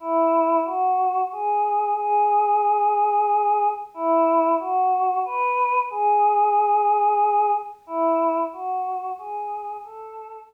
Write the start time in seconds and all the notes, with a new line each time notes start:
0.00 E4
0.65 F#4
1.32 G#4
1.97 G#4
3.94 E4
4.59 F#4
5.25 B4
5.90 G#4
7.87 E4
8.53 F#4
9.18 G#4
9.84 A4